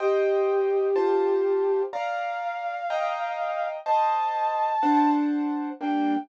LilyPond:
<<
  \new Staff \with { instrumentName = "Flute" } { \time 6/8 \key g \minor \tempo 4. = 62 g'2. | f''2. | a''2 r4 | g''4. r4. | }
  \new Staff \with { instrumentName = "Acoustic Grand Piano" } { \time 6/8 \key g \minor <c'' ees'' g''>4. <f' c'' a''>4. | <d'' f'' bes''>4. <ees'' g'' bes''>4. | <c'' ees'' a''>4. <d' c'' fis'' a''>4. | <g bes d'>4. r4. | }
>>